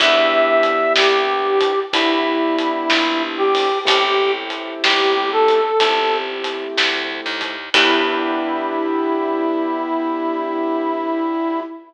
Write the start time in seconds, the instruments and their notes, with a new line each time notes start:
0.00 electric bass (finger) E2, acoustic grand piano B3 D4 E4 G4, brass section E5, kick, crash
0.63 closed hi-hat
0.96 electric bass (finger) C2, brass section G4, snare
1.61 kick, closed hi-hat
1.93 electric bass (finger) D2, acoustic grand piano B3 D4 E4 G4, brass section E4, kick, closed hi-hat
2.58 closed hi-hat
2.90 electric bass (finger) A#1, snare
3.38 brass section G4
3.55 open hi-hat
3.85 electric bass (finger) A1, acoustic grand piano A3 C4 E4 G4, brass section G4, kick, closed hi-hat
4.50 closed hi-hat
4.83 electric bass (finger) G1, brass section G4, snare
5.32 brass section A4
5.48 closed hi-hat
5.80 electric bass (finger) G1, acoustic grand piano A3 C4 E4 G4, kick, closed hi-hat
6.44 closed hi-hat
6.77 electric bass (finger) D2, snare
7.26 electric bass (finger) D#2
7.41 kick, closed hi-hat
7.74 electric bass (finger) E2, acoustic grand piano B3 D4 E4 G4, brass section E4, kick, crash